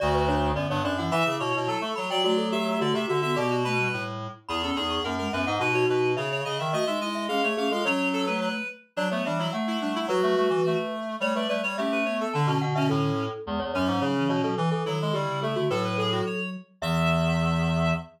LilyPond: <<
  \new Staff \with { instrumentName = "Glockenspiel" } { \time 2/2 \key d \major \tempo 2 = 107 d''8 b'8 cis''4 d''8 cis''8 d''8 fis''8 | b''8 d'''8 cis'''4 a''8 cis'''8 b''8 g''8 | fis'8 a'8 g'4 fis'8 g'8 fis'8 fis'8 | d''4 b''4. r4. |
\key e \major b''4. cis'''8 fis''4 e''8 fis''8 | fis'8 fis'4. e''4 r4 | dis''4. e''8 gis'4 gis'8 a'8 | cis''2~ cis''8 r4. |
\key d \major d''8 cis''8 e''4 fis''2 | b'2.~ b'8 r8 | cis''8 b'8 d''4 e''2 | a''4 fis''8 e''8 a'2 |
\key e \major r8 cis''8 cis''4 cis''4 cis''8 a'8 | r8 a'8 a'4 g'4 a'8 fis'8 | b'4 a'4. r4. | e''1 | }
  \new Staff \with { instrumentName = "Clarinet" } { \time 2/2 \key d \major fis'4 d'4 b8 b8 d'8 e'8 | e''4 cis''4 a'8 a'8 cis''8 d''8 | d''4 e''4 d''8 e''8 e''8 e''8 | g'8 fis'8 b'4. r4. |
\key e \major gis'8 a'8 gis'4 ais'8 ais'8 b'8 dis''8 | b'8 cis''8 b'4 cis''8 cis''8 dis''8 e''8 | dis''8 e''8 dis''4 eis''8 cis''8 eis''8 eis''8 | cis''4 a'8 b'8 b'4 r4 |
\key d \major d'8 b8 d'8 e'8 r8 e'8 d'8 e'8 | fis'2~ fis'8 r4. | cis''8 d''8 b'8 cis''8 g'8 b'8 cis''8 a'8 | d'8 cis'8 r8 cis'2 r8 |
\key e \major r4 cis'2. | r4 e'2. | a'8 b'8 gis'8 fis'8 cis''4 r4 | e''1 | }
  \new Staff \with { instrumentName = "Flute" } { \time 2/2 \key d \major d2. r8 e8 | e'2. r8 fis'8 | a2. r8 b8 | b4 a8 g4. r4 |
\key e \major e'8 cis'8 dis'4 ais8 gis8 b8 dis'8 | dis'2 r2 | fis'8 dis'8 e'4 cis'8 a8 cis'8 eis'8 | cis'4. a4. r4 |
\key d \major fis4 e4 a4 g4 | fis8 fis8 g8 e4 r4. | a4 g4 cis'4 b4 | d2. r4 |
\key e \major gis8 r8 fis4 fis8 e4 fis8 | e8 r8 dis4 d8 cis4 d8 | fis2.~ fis8 r8 | e1 | }
  \new Staff \with { instrumentName = "Clarinet" } { \time 2/2 \key d \major d,2 fis,8 g,8 fis,4 | e8 cis8 b,8 b,8 fis8 a8 fis8 fis8 | fis2 d8 c8 d4 | b,2 a,4. r8 |
\key e \major e,4 e,4 fis,4 fis,8 gis,8 | b,4 b,4 cis4 cis8 dis8 | a8 gis8 gis4 gis8 a4 gis8 | fis2~ fis8 r4. |
\key d \major fis8 a8 g8 fis8 a2 | fis8 a8 a8 e8 a2 | g8 a8 a8 g8 a2 | d8 b,8 b,8 b,8 a,4. r8 |
\key e \major e,8 e,8 fis,8 gis,8 cis4 b,8 b,8 | e8 e8 fis8 gis8 g4 a8 a8 | a,2 r2 | e,1 | }
>>